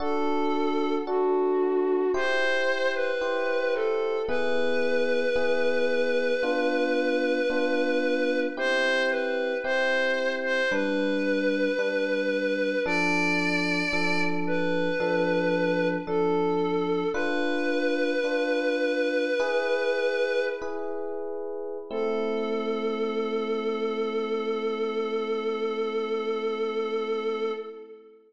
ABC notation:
X:1
M:4/4
L:1/16
Q:1/4=56
K:Am
V:1 name="Choir Aahs"
A4 ^F4 c3 B3 A2 | B16 | c2 B2 c3 c B8 | d6 B6 A4 |
"^rit." B12 z4 | A16 |]
V:2 name="Electric Piano 1"
[D^FA]4 [DFA]4 [EGc]4 [EGc]4 | [B,E^G]4 [B,EG]4 [B,DF]4 [B,DF]4 | [CEG]4 [CEG]4 [G,DB]4 [G,DB]4 | [F,DA]4 [F,DA]4 [F,DA]4 [F,DA]4 |
"^rit." [DFB]4 [DFB]4 [E^GB]4 [EGB]4 | [A,CE]16 |]